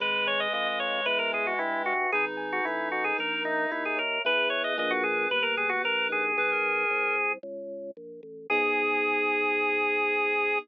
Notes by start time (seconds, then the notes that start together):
0.00 G#1 G#3 B4
0.26 C#5 G#5
0.40 D#5
0.53 F2 B4 D#5
0.66 D#5
0.80 C#5 D#5
1.05 E2 B4
1.19 A#4
1.32 G#4 G#5
1.47 F#4
1.59 G2 E4 B4
1.86 F#4 E5
2.12 G#1 D#4 G#4 B4
2.37 G#5
2.52 F#4
2.65 A1 E4 B4
2.92 F#4 D#5
3.04 G#4
3.18 A#1 A#4
3.45 D#4 E5
3.71 D#2 E4 A#4
3.85 G#4
3.97 A#4 C#5
4.25 E2 B3 E4 G#4 B4
4.50 C#5
4.64 D#5
4.78 A#1 A#3 D4 F4 G#4 D#5
4.90 F#4
5.03 G#4
5.30 G1 A#3 B4
5.42 A#4
5.57 G4 G#4
5.69 F#4
5.84 A#1 A#3 A#4
6.09 D#4 G#4
6.37 B1 G#4 B4
6.51 A#4
6.90 C2
7.43 C#2
7.97 A#1
8.23 A1
8.50 G#2 B3 D#4 G#4